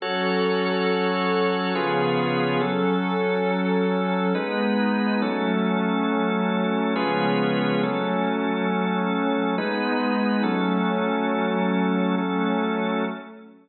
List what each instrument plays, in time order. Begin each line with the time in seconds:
0.00 pad 5 (bowed) F#3 C#4 A4, drawbar organ F#4 A4 C#5
1.73 pad 5 (bowed) C#3 F3 B3 G#4, drawbar organ C#4 F4 G#4 B4
2.61 drawbar organ F#3 C#4 A4, pad 5 (bowed) F#3 C#4 A4
4.34 drawbar organ G#3 D#4 B4, pad 5 (bowed) G#3 B3 D#4
5.21 pad 5 (bowed) F#3 A3 C#4, drawbar organ F#3 C#4 A4
6.95 pad 5 (bowed) C#3 F3 G#3 B3, drawbar organ C#4 F4 G#4 B4
7.82 pad 5 (bowed) F#3 A3 C#4, drawbar organ F#3 C#4 A4
9.57 pad 5 (bowed) G#3 B3 D#4, drawbar organ G#3 D#4 B4
10.43 drawbar organ F#3 C#4 A4, pad 5 (bowed) F#3 A3 C#4
12.17 pad 5 (bowed) F#3 A3 C#4, drawbar organ F#3 C#4 A4